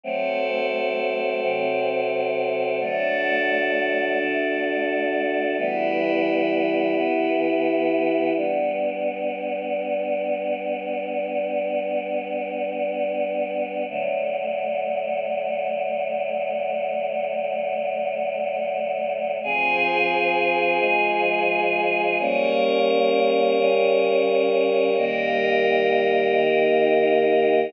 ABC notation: X:1
M:3/4
L:1/8
Q:1/4=65
K:Em
V:1 name="Choir Aahs"
[F,A,C]3 [C,F,C]3 | [D,F,A,]3 [D,A,D]3 | [E,G,B,]3 [E,B,E]3 | [K:G] [G,B,D]6- |
[G,B,D]6 | [D,F,A,]6- | [D,F,A,]6 | [K:Fm] [F,CA]3 [F,A,A]3 |
[G,B,D]3 [D,G,D]3 | [E,G,B,]3 [E,B,E]3 |]
V:2 name="Pad 5 (bowed)"
[FAc]6 | [DFA]6 | [EGB]6 | [K:G] z6 |
z6 | z6 | z6 | [K:Fm] [FAc]6 |
[GBd]6 | [EGB]6 |]